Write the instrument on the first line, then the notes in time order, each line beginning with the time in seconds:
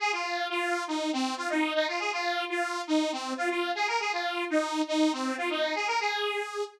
lead 2 (sawtooth)
0.00 G#4
0.12 F4
0.50 F4
0.88 D#4
1.13 C4
1.37 F4
1.50 D#4
1.74 D#4
1.88 F4
1.99 G#4
2.12 F4
2.50 F4
2.87 D#4
3.12 C4
3.37 F4
3.50 F4
3.75 G#4
3.88 A#4
4.00 G#4
4.13 F4
4.50 D#4
4.88 D#4
5.13 C4
5.38 F4
5.50 D#4
5.75 G#4
5.87 A#4
6.00 G#4